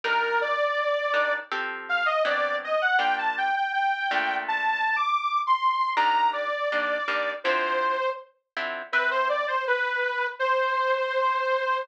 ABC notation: X:1
M:4/4
L:1/16
Q:1/4=81
K:Fmix
V:1 name="Lead 2 (sawtooth)"
B2 d6 z2 f e d2 e ^f | g a g g g4 (3a4 d'4 c'4 | b2 d6 c4 z4 | [K:Cmix] =B c d c B4 c8 |]
V:2 name="Acoustic Guitar (steel)"
[G,DEB]6 [G,DEB]2 [F,CGA]4 [^F,=B,CD]4 | [G,B,DF]6 [B,,A,DF]10 | [E,G,B,D]4 [E,G,B,D]2 [E,G,B,D]2 [D,F,C=E]6 [D,F,CE]2 | [K:Cmix] [C=Beg]16 |]